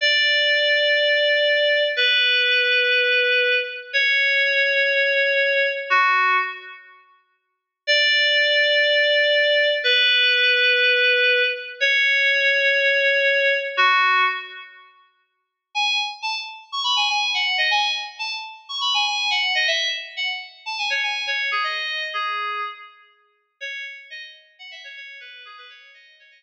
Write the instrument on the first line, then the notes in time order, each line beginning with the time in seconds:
electric piano 2
0.01 D5
1.96 B4
3.93 C#5
5.90 F#4
7.87 D5
9.84 B4
11.80 C#5
13.77 F#4
15.75 G#5
16.22 A5
16.72 C#6
16.84 B5
16.96 G#5
17.09 G#5
17.34 F#5
17.58 D#5
17.71 G#5
18.19 A5
18.69 C#6
18.81 B5
18.94 G#5
19.06 G#5
19.30 F#5
19.55 D#5
19.67 E5
20.16 F#5
20.66 A5
20.78 G#5
20.90 C#5
21.03 G#5
21.27 C#5
21.51 G#4
21.64 D#5
22.13 G#4
23.60 C#5
24.10 D#5
24.59 F#5
24.71 E5
24.84 C#5
24.96 C#5
25.20 B4
25.45 G#4
25.57 B4
25.69 C#5
25.94 D#5
26.19 C#5
26.31 D#5